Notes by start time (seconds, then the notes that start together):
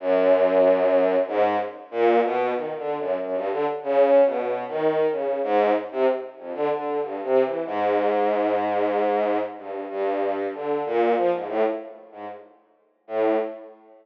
0.00 F#2
1.27 G#2
1.91 A#2
2.23 B2
2.54 D#3
2.77 D3
2.98 F#2
3.20 F#2
3.35 G2
3.51 D3
3.83 C#3
4.25 B2
4.68 D#3
5.11 C#3
5.43 G#2
5.91 C3
6.38 F2
6.54 D3
6.71 D3
7.02 G2
7.23 C3
7.44 E3
7.66 G#2
9.57 G2
9.89 G2
10.54 D3
10.86 A#2
11.17 F3
11.33 G#2
11.48 A2
12.12 G#2
13.07 A2